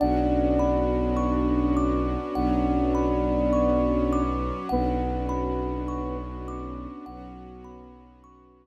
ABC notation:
X:1
M:4/4
L:1/8
Q:1/4=51
K:Bdor
V:1 name="Flute"
[Dd]8 | [B,B]3 z5 |]
V:2 name="Kalimba"
f b c' d' f b c' d' | f b c' d' f b c' z |]
V:3 name="Violin" clef=bass
B,,,4 B,,,4 | B,,,4 B,,,4 |]
V:4 name="String Ensemble 1"
[B,CDF]4 [F,B,CF]4 | [B,CDF]4 [F,B,CF]4 |]